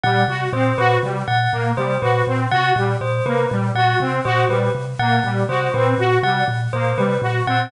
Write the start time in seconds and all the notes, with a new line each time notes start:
0.03 A#2 G3 F#5
0.28 C3 F#4
0.53 A#2 C4 C5
0.78 A#2 F#4 B4
1.03 C3 G3
1.28 A#2 F#5
1.52 A#2 A#3
1.77 C3 G3 C5
2.02 A#2 F#4 B4
2.27 A#2 C4
2.51 C3 F#4 F#5
2.76 A#2 G3
3.01 A#2 C5
3.26 C3 A#3 B4
3.51 A#2 G3
3.75 A#2 F#4 F#5
4.00 C3 C4
4.25 A#2 F#4 C5
4.49 A#2 G3 B4
4.75 C3
4.99 A#2 A#3 F#5
5.24 A#2 G3
5.49 C3 F#4 C5
5.74 A#2 C4 B4
5.98 A#2 F#4
6.23 C3 G3 F#5
6.48 A#2
6.73 A#2 A#3 C5
6.98 C3 G3 B4
7.22 A#2 F#4
7.47 A#2 C4 F#5